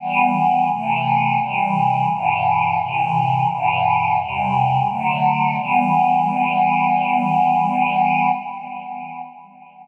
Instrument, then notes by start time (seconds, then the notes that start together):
choir aahs
0.00 E3 G3 B3
0.69 C3 E3 A3
1.40 C3 E3 G3
2.09 G2 B2 E3
2.79 A2 C3 E3
3.49 G2 B2 E3
4.19 E2 C3 G3
4.88 D3 F#3 A3
5.58 E3 G3 B3